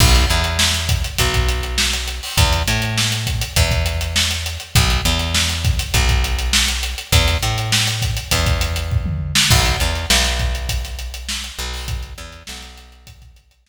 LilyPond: <<
  \new Staff \with { instrumentName = "Electric Bass (finger)" } { \clef bass \time 4/4 \key b \mixolydian \tempo 4 = 101 b,,8 e,4. b,,2 | e,8 a,4. e,2 | b,,8 e,4. b,,2 | e,8 a,4. e,2 |
b,,8 e,8 b,,2~ b,,8 b,,8~ | b,,8 e,8 b,,2. | }
  \new DrumStaff \with { instrumentName = "Drums" } \drummode { \time 4/4 <cymc bd>16 <hh sn>16 hh16 hh16 sn16 hh16 <hh bd>16 hh16 <hh bd>16 <hh bd>16 hh16 hh16 sn16 <hh sn>16 hh16 hho16 | <hh bd>16 hh16 hh16 hh16 sn16 hh16 <hh bd>16 hh16 <hh bd>16 <hh bd>16 hh16 hh16 sn16 hh16 hh16 hh16 | <hh bd>16 hh16 hh16 <hh sn>16 sn16 hh16 <hh bd>16 <hh sn>16 <hh bd>16 <hh bd>16 hh16 hh16 sn16 hh16 hh16 hh16 | <hh bd>16 <hh sn>16 hh16 hh16 sn16 hh16 <hh bd>16 hh16 <hh bd>16 <hh bd>16 hh16 hh16 <bd tomfh>16 toml8 sn16 |
<cymc bd>16 hh16 hh16 <hh sn>16 sn16 <hh sn>16 <hh bd>16 hh16 <hh bd>16 <hh sn>16 hh16 hh16 sn16 hh16 <hh sn>16 hho16 | <hh bd>16 hh16 hh16 hh16 sn16 hh16 <hh sn>16 hh16 <hh bd>16 <hh bd>16 hh16 hh16 sn4 | }
>>